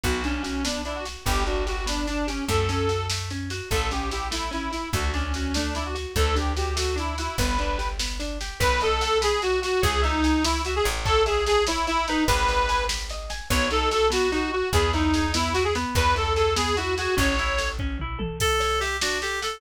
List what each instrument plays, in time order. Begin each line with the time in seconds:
0.03 electric bass (finger) B1, orchestral harp B3, accordion F#4, kick, snare
0.24 accordion C#4, orchestral harp D4, snare
0.43 orchestral harp F#4, snare
0.64 orchestral harp B3, accordion D4, snare
0.85 orchestral harp D4, accordion E4, snare
0.95 accordion F#4
1.05 orchestral harp F#4, snare
1.26 electric bass (finger) G1, orchestral harp B3, accordion G4, kick, snare
1.46 orchestral harp D4, accordion F#4, snare
1.67 accordion F#4, orchestral harp G4, snare
1.86 orchestral harp B3, accordion D4, snare
2.07 orchestral harp D4, accordion D4, snare
2.27 accordion C#4, orchestral harp G4, snare
2.48 electric bass (finger) F#2, orchestral harp A3, accordion A4, kick, snare
2.69 orchestral harp C#4, snare
2.89 orchestral harp F#4, snare
3.10 orchestral harp A3, snare
3.30 orchestral harp C#4, snare
3.50 orchestral harp F#4, snare
3.70 electric bass (finger) A1, orchestral harp A3, accordion A4, kick, snare
3.91 orchestral harp C#4, accordion G4, snare
4.11 orchestral harp E4, accordion G4, snare
4.31 orchestral harp A3, accordion E4, snare
4.51 orchestral harp C#4, accordion E4, snare
4.72 orchestral harp E4, accordion E4, snare
4.93 electric bass (finger) D2, orchestral harp A3, accordion F#4, kick, snare
5.14 accordion C#4, orchestral harp D4, snare
5.34 orchestral harp F#4, snare
5.54 orchestral harp A3, accordion D4, snare
5.75 orchestral harp D4, accordion E4, snare
5.85 accordion F#4
5.95 orchestral harp F#4, snare
6.16 electric bass (finger) D2, orchestral harp A3, accordion A4, kick, snare
6.35 orchestral harp D4, accordion G4, snare
6.57 orchestral harp F#4, accordion G4, snare
6.76 orchestral harp A3, accordion F#4, snare
6.96 orchestral harp D4, accordion E4, snare
7.18 accordion E4, orchestral harp F#4, snare
7.38 electric bass (finger) G1, orchestral harp B3, accordion B4, kick, snare
7.59 orchestral harp D4, snare
7.78 orchestral harp G4, snare
7.99 orchestral harp B3, snare
8.20 orchestral harp D4, snare
8.41 orchestral harp G4, snare
8.60 electric bass (finger) B1, orchestral harp B4, accordion B4, kick, snare
8.81 accordion A4, orchestral harp D#5, snare
9.01 accordion A4, orchestral harp F#5, snare
9.21 accordion G#4, orchestral harp B4, snare
9.42 accordion F#4, orchestral harp D#5, snare
9.62 accordion F#4, orchestral harp F#5, snare
9.82 electric bass (finger) C#2, accordion G#4, orchestral harp C#5, kick, snare
10.02 accordion D#4, orchestral harp E5, snare
10.24 orchestral harp G#5, snare
10.44 accordion E4, orchestral harp C#5, snare
10.65 accordion F#4, orchestral harp E5, snare
10.76 accordion G#4
10.84 electric bass (finger) A1, orchestral harp G#5, snare
11.05 accordion A4, orchestral harp C#5, kick, snare
11.26 accordion G#4, orchestral harp E5, snare
11.47 accordion G#4, orchestral harp A5, snare
11.67 accordion E4, orchestral harp C#5, snare
11.87 accordion E4, orchestral harp E5, snare
12.07 accordion D#4, orchestral harp B4, snare
12.27 electric bass (finger) G#1, accordion B4, kick, snare
12.48 orchestral harp D#5, snare
12.69 orchestral harp G#5, snare
12.88 orchestral harp B4, snare
13.09 orchestral harp D#5, snare
13.30 orchestral harp G#5, snare
13.50 electric bass (finger) B1, orchestral harp B3, accordion C#5, kick, snare
13.71 orchestral harp D#4, accordion A4, snare
13.91 orchestral harp F#4, accordion A4, snare
14.10 orchestral harp B3, accordion F#4, snare
14.32 orchestral harp D#4, accordion F#4, snare
14.52 accordion F#4, orchestral harp F#4
14.73 electric bass (finger) E2, orchestral harp B3, accordion G#4, kick, snare
14.93 accordion D#4, orchestral harp E4, snare
15.14 orchestral harp G#4, snare
15.34 orchestral harp B3, accordion E4, snare
15.54 orchestral harp E4, accordion F#4, snare
15.64 accordion G#4
15.75 orchestral harp B3, snare
15.95 electric bass (finger) E2, accordion B4, kick, snare
16.15 orchestral harp E4, accordion A4, snare
16.35 orchestral harp G#4, accordion A4, snare
16.56 orchestral harp B3, accordion G#4, snare
16.76 orchestral harp E4, accordion F#4, snare
16.97 accordion F#4, orchestral harp G#4, snare
17.17 electric bass (finger) A1, orchestral harp C#4, accordion C#5, kick, snare
17.39 orchestral harp E4, snare
17.58 orchestral harp A4, snare
17.79 orchestral harp C#4, kick
17.99 orchestral harp E4, mid tom
18.19 orchestral harp A4, high tom
18.40 clarinet A4, orchestral harp A4, kick, snare, crash
18.60 orchestral harp C#5, snare
18.80 clarinet G4, orchestral harp E5, snare
19.01 orchestral harp D4, clarinet F#4, snare
19.22 clarinet G4, orchestral harp A4, snare
19.42 clarinet A4, orchestral harp F#5, snare